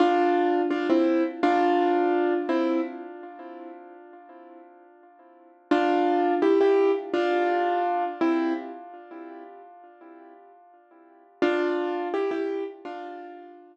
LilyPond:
\new Staff { \time 4/4 \key f \major \tempo 4 = 84 <d' f'>4 <d' f'>16 <c' e'>8 r16 <d' f'>4. <c' e'>8 | r1 | <d' f'>4 <e' g'>16 <e' g'>8 r16 <d' f'>4. <c' e'>8 | r1 |
<d' f'>4 <e' g'>16 <e' g'>8 r16 <d' f'>4. r8 | }